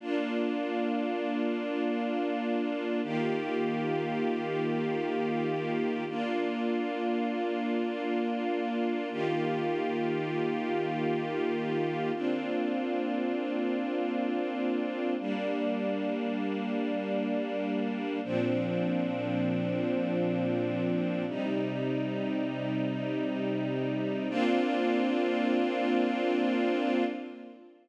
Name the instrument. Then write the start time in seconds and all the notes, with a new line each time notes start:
string ensemble 1
0.00 A#3 D4 F4
3.03 D#3 A#3 F4 G4
6.09 A#3 D4 F4
9.11 D#3 A#3 F4 G4
12.14 A#3 C4 D4 F4
15.19 G3 A#3 D4
18.24 A#2 F3 C4 D4
21.27 C3 G3 D#4
24.30 A#3 C4 D4 F4